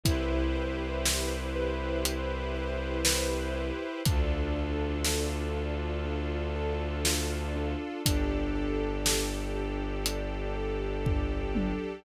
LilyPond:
<<
  \new Staff \with { instrumentName = "Acoustic Grand Piano" } { \time 4/4 \key d \minor \tempo 4 = 60 e'8 c''8 e'8 b'8 e'8 c''8 b'8 e'8 | d'8 a'8 d'8 f'8 d'8 a'8 f'8 d'8 | d'8 a'8 d'8 g'8 d'8 a'8 g'8 d'8 | }
  \new Staff \with { instrumentName = "Violin" } { \clef bass \time 4/4 \key d \minor c,1 | d,1 | g,,1 | }
  \new Staff \with { instrumentName = "String Ensemble 1" } { \time 4/4 \key d \minor <e' g' b' c''>1 | <d' f' a'>1 | <d' g' a'>1 | }
  \new DrumStaff \with { instrumentName = "Drums" } \drummode { \time 4/4 <hh bd>4 sn4 hh4 sn4 | <hh bd>4 sn4 r4 sn4 | <hh bd>4 sn4 hh4 <bd tomfh>8 tommh8 | }
>>